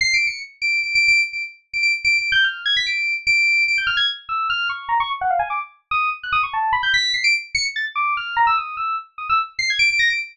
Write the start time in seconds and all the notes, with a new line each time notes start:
0.01 C7
0.14 D7
0.27 C#7
0.62 D7
0.83 D7
0.95 D7
1.08 D7
1.33 D7
1.73 D7
1.83 D7
2.05 D7
2.18 D7
2.32 G6
2.44 F6
2.66 G#6
2.77 B6
2.86 D7
3.27 D7
3.68 D7
3.78 G6
3.87 F6
3.97 G#6
4.29 E6
4.50 F6
4.69 C#6
4.89 A#5
5.00 C#6
5.21 F#5
5.30 F5
5.39 G#5
5.50 D6
5.91 D#6
6.23 F#6
6.32 D#6
6.43 C#6
6.53 A5
6.73 B5
6.83 G6
6.94 B6
7.14 C7
7.24 D7
7.55 C#7
7.76 A6
7.95 D6
8.17 F6
8.37 A#5
8.47 E6
8.57 D#6
8.77 E6
9.18 D#6
9.30 E6
9.59 C7
9.70 G#6
9.79 D7
9.90 D7
9.99 A#6
10.10 D7